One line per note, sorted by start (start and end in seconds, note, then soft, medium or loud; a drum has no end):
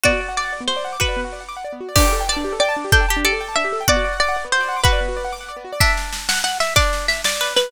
0.04 0.12 B3 medium
0.04 0.91 F#4 loud
0.04 0.33 D5 loud
0.04 kick medium
0.13 0.20 F#4 medium
0.21 0.28 D5 medium
0.29 0.36 F#5 medium
0.37 0.63 D5 medium
0.37 0.44 D6 medium
0.45 0.52 F#5 medium
0.53 0.60 D5 medium
0.61 0.68 B3 medium
0.68 0.76 F#4 medium
0.68 0.96 C5 medium
0.77 0.84 D5 medium
0.85 0.92 F#5 medium
0.93 1.00 D6 medium
1.00 1.44 F#4 medium
1.00 1.69 B4 medium
1.00 1.08 F#5 medium
1.00 kick loud
1.09 1.16 D5 medium
1.17 1.24 B3 medium
1.25 1.32 F#4 medium
1.33 1.40 D5 medium
1.41 1.48 F#5 medium
1.49 1.56 D6 medium
1.57 1.64 F#5 medium
1.65 1.72 D5 medium
1.73 1.80 B3 medium
1.81 1.88 F#4 medium
1.89 1.96 D5 medium
1.96 2.04 D4 loud
1.96 2.85 G4 loud
1.96 2.23 D5 loud
1.96 kick loud
1.96 crash loud
2.05 2.12 G4 medium
2.13 2.20 A4 medium
2.21 2.28 G5 medium
2.29 2.59 D5 loud
2.29 2.36 A5 loud
2.37 2.44 D4 medium
2.45 2.52 G4 medium
2.53 2.60 A4 medium
2.60 2.91 D5 loud
2.60 2.68 G5 loud
2.69 2.76 A5 medium
2.77 2.84 D4 medium
2.85 2.92 G4 medium
2.92 3.06 D4 loud
2.92 3.00 A4 loud
2.92 3.19 G5 loud
2.92 kick loud
3.01 3.08 G5 medium
3.09 3.24 G4 medium
3.09 3.16 A5 loud
3.17 3.24 D4 medium
3.25 3.32 G4 loud
3.25 3.67 A4 loud
3.25 3.56 D5 loud
3.33 3.40 A4 medium
3.41 3.48 G5 medium
3.49 3.56 A5 medium
3.56 3.64 D4 medium
3.56 3.83 E5 loud
3.65 3.72 G4 medium
3.73 3.80 A4 medium
3.81 3.88 G5 medium
3.88 3.96 B3 loud
3.88 4.75 F#4 loud
3.88 4.17 D5 loud
3.88 kick loud
3.97 4.04 F#4 medium
4.04 4.12 D5 medium
4.13 4.20 F#5 medium
4.20 4.46 D5 loud
4.20 4.28 D6 medium
4.29 4.36 F#5 loud
4.37 4.44 D5 medium
4.45 4.52 B3 medium
4.52 4.60 F#4 medium
4.52 4.81 C5 loud
4.61 4.68 D5 loud
4.69 4.76 F#5 medium
4.77 4.84 D6 medium
4.84 5.29 F#4 medium
4.84 5.51 B4 loud
4.84 4.92 F#5 loud
4.84 kick loud
4.93 5.00 D5 medium
5.01 5.08 B3 medium
5.09 5.16 F#4 medium
5.17 5.24 D5 medium
5.25 5.32 F#5 medium
5.33 5.40 D6 medium
5.41 5.48 F#5 medium
5.49 5.56 D5 medium
5.57 5.64 B3 medium
5.65 5.72 F#4 medium
5.73 5.80 D5 loud
5.80 6.61 D4 loud
5.80 6.20 E5 medium
5.80 kick loud
5.80 snare medium
5.97 snare medium
6.13 snare loud
6.29 6.42 F#5 medium
6.29 snare loud
6.44 6.58 F#5 loud
6.44 snare medium
6.60 6.74 E5 medium
6.60 snare medium
6.76 7.32 D4 medium
6.76 7.06 D5 loud
6.76 kick loud
6.76 snare medium
6.93 snare medium
7.08 7.21 E5 medium
7.08 snare medium
7.24 7.53 D5 medium
7.24 snare loud
7.41 7.71 B4 medium
7.41 snare medium
7.56 7.71 B4 medium
7.56 snare loud